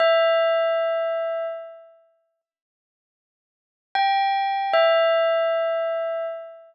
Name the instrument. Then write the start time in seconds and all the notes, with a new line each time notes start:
tubular bells
0.00 E5
3.95 G5
4.73 E5